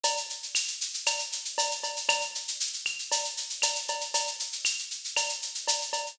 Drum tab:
SH |xxxxxxxxxxxxxxxx|xxxxxxxxxxxxxxxx|xxxxxxxxxxxxxxxx|
CB |x-------x---x-x-|x-------x---x-x-|x-------x---x-x-|
CL |----x---x-------|x-----x-----x---|----x---x-------|